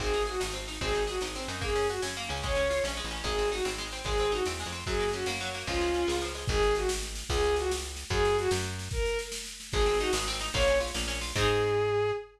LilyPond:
<<
  \new Staff \with { instrumentName = "Violin" } { \time 6/8 \key aes \mixolydian \tempo 4. = 148 aes'4 ges'8 r4. | aes'4 ges'8 r4. | aes'4 ges'8 r4. | des''4. r4. |
aes'4 ges'8 r4. | aes'4 ges'8 r4. | aes'4 ges'8 r4. | f'2 r4 |
aes'4 ges'8 r4. | aes'4 ges'8 r4. | aes'4 ges'8 r4. | bes'4 r2 |
aes'4 ges'8 r4. | des''4 r2 | aes'2. | }
  \new Staff \with { instrumentName = "Pizzicato Strings" } { \time 6/8 \key aes \mixolydian c'8 ees'8 aes'8 ees'8 c'8 ees'8 | c'8 ees'8 aes'8 ees'8 c'8 ees'8 | bes8 des'8 ges'8 des'8 bes8 des'8 | aes8 des'8 f'8 des'8 aes8 des'8 |
aes8 c'8 ees'8 c'8 aes8 c'8 | aes8 c'8 ees'8 c'8 aes8 c'8 | ges8 bes8 des'8 bes8 ges8 bes8 | f8 aes8 des'8 aes8 f8 aes8 |
r2. | r2. | r2. | r2. |
aes8 c'8 ees'8 aes8 c'8 ees'8 | bes8 des'8 f'8 bes8 des'8 f'8 | <c' ees' aes'>2. | }
  \new Staff \with { instrumentName = "Electric Bass (finger)" } { \clef bass \time 6/8 \key aes \mixolydian aes,,4. aes,,4. | aes,,4. aes,,4 ges,8~ | ges,4. ges,4 des,8~ | des,4. bes,,8. a,,8. |
aes,,4. aes,,4. | aes,,4. e,8. f,8. | ges,4. ges,4. | des,4. des,4. |
aes,,2. | des,2. | ges,4. ges,4. | r2. |
aes,,4. aes,,4. | bes,,4. bes,,4. | aes,2. | }
  \new DrumStaff \with { instrumentName = "Drums" } \drummode { \time 6/8 <bd sn>16 sn16 sn16 sn16 sn16 sn16 sn16 sn16 sn16 sn16 sn16 sn16 | <bd sn>16 sn16 sn16 sn16 sn16 sn16 sn16 sn16 sn16 sn16 sn16 sn16 | <bd sn>16 sn16 sn16 sn16 sn16 sn16 sn16 sn16 sn16 sn16 sn16 sn16 | <bd sn>16 sn16 sn16 sn16 sn16 sn16 sn16 sn16 sn16 sn16 sn16 sn16 |
<bd sn>16 sn16 sn16 sn16 sn16 sn16 sn16 sn16 sn16 sn16 sn16 sn16 | <bd sn>16 sn16 sn16 sn16 sn16 sn16 sn16 sn16 sn16 sn16 sn16 sn16 | <bd sn>16 sn16 sn16 sn16 sn16 sn16 sn16 sn16 sn16 sn16 sn16 sn16 | <bd sn>16 sn16 sn16 sn16 sn16 sn16 sn16 sn16 sn16 sn16 sn16 sn16 |
<bd sn>8 sn8 sn8 sn8 sn8 sn8 | <bd sn>8 sn8 sn8 sn8 sn8 sn8 | <bd sn>8 sn8 sn8 sn8 sn8 sn8 | <bd sn>8 sn8 sn8 sn8 sn8 sn8 |
<bd sn>16 sn16 sn16 sn16 sn16 sn16 sn16 sn16 sn16 sn16 sn16 sn16 | <bd sn>16 sn16 sn16 sn16 sn16 sn16 sn16 sn16 sn16 sn16 sn16 sn16 | <cymc bd>4. r4. | }
>>